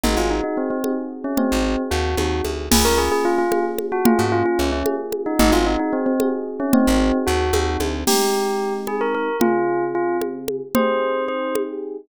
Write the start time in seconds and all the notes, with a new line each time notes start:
0.03 G#1 C4 D#4 F#4 G#4, low conga
0.17 G#1 F4
0.30 D#4
0.44 D#4
0.57 C4
0.70 C4
0.84 C4 D#4 F#4 G#4, high conga
1.24 C#4
1.37 C4 D#4 F#4 G#4, low conga
1.52 G#1
1.91 D#2 F#4
2.17 D#2 C4 D#4 F#4 G#4, high conga
2.45 D2, high conga
2.71 C#2 A#3 C#4 F4 G#4, crash, low conga
2.85 C#2 A#4
2.98 G#4
3.12 G#4
3.25 F4
3.38 F4
3.51 A#3 C#4 F4 G#4, high conga
3.78 high conga
3.92 F#4
4.05 A#3 C#4 F4 G#4, low conga
4.19 G#2 F#4
4.32 F4
4.46 F4
4.59 C#2 C#4
4.72 C#4
4.86 A#3 C#4 F4 G#4, high conga
5.12 high conga
5.26 D#4
5.39 G#1 C4 D#4 F#4 G#4, low conga
5.52 G#1 F4
5.66 D#4
5.79 D#4
5.93 C4
6.06 C4
6.20 C4 D#4 F#4 G#4, high conga
6.60 C#4
6.73 C4 D#4 F#4 G#4, low conga
6.87 G#1
7.27 D#2 F#4
7.53 D#2 C4 D#4 F#4 G#4, high conga
7.80 D2, high conga
8.07 G#3 C4 D#4 G4, crash, low conga
8.87 G#4, high conga
9.01 A#4
9.15 A#4
9.40 C#3 C4 F4 G#4, low conga
9.95 F4
10.21 high conga
10.48 high conga
10.75 C4 D#4 G4 G#4 C5, low conga
11.28 C5
11.55 high conga